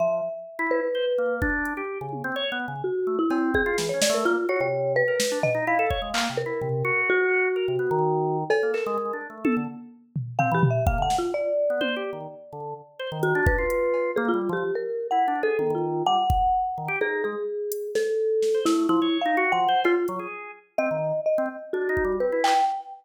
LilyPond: <<
  \new Staff \with { instrumentName = "Marimba" } { \time 6/4 \tempo 4 = 127 e''4. b'4. r2. | fis'8. e'8. gis'8. cis''16 d''16 ais'16 f'8 cis''16 cis''8. b'4 dis''8 | f''4. ais'4. fis'2. | a'8 ais'4 r2 r8 \tuplet 3/2 { f''8 g'8 e''8 f''8 fis''8 f'8 } |
d''1 fis'8 b'4. | gis'16 f'8 g'8 ais'8. \tuplet 3/2 { fis''4 a'4 f'4 } fis''2 | gis'8 gis'4. a'4. e'8 \tuplet 3/2 { e'4 f''4 fis''4 } | f'8 r4. dis''4 dis''8 r8 fis'4 b'8 g''8 | }
  \new Staff \with { instrumentName = "Drawbar Organ" } { \time 6/4 f8 r8. e'8 r16 c''16 r16 ais8 d'8. g'8 cis8 c'16 \tuplet 3/2 { cis''8 b8 cis8 } | r8 a16 r16 c'8. f'16 \tuplet 3/2 { e8 cis'8 a8 } ais16 r16 fis'16 c4 ais'16 r16 d'16 r16 dis'16 | e'16 a'16 cis''16 gis16 \tuplet 3/2 { ais8 c8 e'8 } c8 fis'4. ais'16 c16 b16 dis4~ dis16 | r16 ais16 a'16 gis16 \tuplet 3/2 { gis8 d'8 a8 } a'16 d16 r4. c'16 e16 r8 ais16 d16 r8 |
r8. b16 \tuplet 3/2 { c''8 g'8 dis8 } r8 d8 r8 c''16 dis8 d'8 f'4~ f'16 | \tuplet 3/2 { ais8 g8 f8 } r4 \tuplet 3/2 { e'8 d'8 gis'8 } dis16 dis8. g16 r4 r16 dis16 g'16 | dis'8 gis16 r2 r8 c''16 a8 f16 cis''8 dis'16 \tuplet 3/2 { fis'8 f8 c''8 } | f'16 r16 fis16 gis'8. r8 c'16 dis8 r8 c'16 r8 \tuplet 3/2 { d'8 dis'8 g8 } c'16 e'8 r16 | }
  \new DrumStaff \with { instrumentName = "Drums" } \drummode { \time 6/4 r4 r4 r4 bd8 hh8 r8 tommh8 r4 | r4 cb8 bd8 sn8 sn8 r4 r4 sn8 tomfh8 | r8 bd8 hc4 tomfh4 r4 r4 r4 | cb8 hc8 r4 tommh4 r8 tomfh8 tomfh8 tomfh8 bd8 sn8 |
r4 tommh4 r4 r4 hh8 bd8 hh8 cb8 | r4 r4 r4 tommh4 r8 bd8 r4 | r4 r8 hh8 sn4 sn8 sn8 r4 r4 | cb8 hh8 r4 r4 r4 r8 bd8 r8 hc8 | }
>>